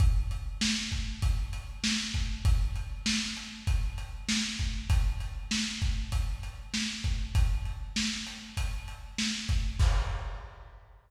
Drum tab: CC |--------|--------|--------|--------|
HH |xx-xxx-x|xx-xxx-x|xx-xxx-x|xx-xxx-x|
SD |--o---o-|--o---o-|--o---o-|--o---o-|
BD |o--oo--o|o---o--o|o--oo--o|o---o--o|

CC |x-------|
HH |--------|
SD |--------|
BD |o-------|